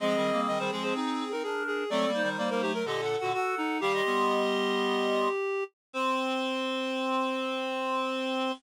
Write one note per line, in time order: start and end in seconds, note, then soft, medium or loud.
0.00 0.15 F3 medium
0.00 0.15 G#3 medium
0.00 1.33 C4 loud
0.00 1.33 G#4 loud
0.00 0.41 D#5 loud
0.16 0.31 D#3 medium
0.16 0.31 G3 medium
0.32 0.47 G3 medium
0.32 0.47 A#3 medium
0.47 0.58 D#3 medium
0.47 0.58 G3 medium
0.47 0.59 D#5 loud
0.59 0.70 D#3 medium
0.59 0.70 G3 medium
0.59 0.71 C5 loud
0.72 0.93 F3 medium
0.72 0.93 G#3 medium
0.72 0.83 G#4 loud
0.83 0.94 C5 loud
0.95 1.24 C4 medium
0.95 1.24 D#4 medium
0.95 1.29 G#4 medium
1.32 1.43 C4 medium
1.32 1.43 D#4 medium
1.32 1.43 A#4 medium
1.43 1.84 D4 medium
1.43 1.63 G#4 medium
1.43 1.84 A#4 medium
1.67 1.90 G#4 loud
1.90 2.05 F#3 loud
1.90 2.05 A3 loud
1.90 2.11 C4 medium
1.90 2.11 A4 loud
1.90 2.29 D5 loud
2.07 2.22 G3 medium
2.07 2.22 A#3 medium
2.14 2.72 D#4 medium
2.14 2.72 C5 medium
2.22 2.37 D#3 medium
2.22 2.37 G3 medium
2.38 2.49 G3 medium
2.38 2.49 A#3 medium
2.38 2.49 D5 medium
2.50 2.62 G3 medium
2.50 2.62 A#3 medium
2.50 2.61 A#4 loud
2.62 2.83 F#3 medium
2.62 2.83 A3 medium
2.62 2.73 G4 loud
2.74 2.86 A#4 loud
2.85 3.16 A#2 medium
2.85 3.16 D3 medium
2.85 3.01 G4 medium
2.85 3.19 A4 medium
2.85 3.01 D#5 medium
3.01 3.16 A4 medium
3.01 3.16 F#5 medium
3.17 3.32 F#4 medium
3.17 3.32 A4 medium
3.17 3.32 F#5 medium
3.22 3.33 A#2 medium
3.22 3.33 D3 medium
3.33 3.55 F#4 loud
3.33 3.78 A4 medium
3.33 3.78 F#5 loud
3.58 3.81 D#4 loud
3.81 4.02 D#3 medium
3.81 4.02 G3 loud
3.81 5.64 G4 loud
3.81 3.92 F5 medium
3.81 3.92 D6 loud
3.93 5.29 D#5 loud
3.93 5.29 C6 loud
4.05 5.28 G3 medium
4.05 5.28 B3 medium
5.93 8.51 C4 loud
5.93 8.52 C5 loud
5.93 8.53 C6 loud